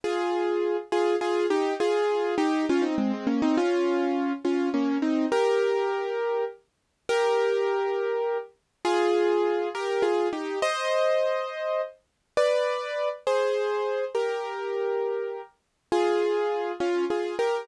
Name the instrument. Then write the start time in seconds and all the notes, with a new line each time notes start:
acoustic grand piano
0.04 F4 G#4
0.92 F4 G#4
1.21 F4 G#4
1.50 D#4 G4
1.80 F4 G#4
2.38 D#4 G4
2.69 C#4 F4
2.82 C4 D#4
2.98 G#3 C4
3.13 G#3 C4
3.27 A#3 C#4
3.42 C4 D#4
3.57 C#4 F4
4.45 C#4 F4
4.74 A#3 C#4
5.02 C4 D#4
5.32 G4 A#4
7.09 G4 A#4
8.85 F4 G#4
9.75 G4 A#4
10.02 F4 G#4
10.33 D#4 G4
10.62 C5 D#5
12.37 B4 D5
13.27 G#4 C5
14.15 G4 A#4
15.92 F4 G#4
16.80 C#4 F4
17.10 F4 G#4
17.39 G4 A#4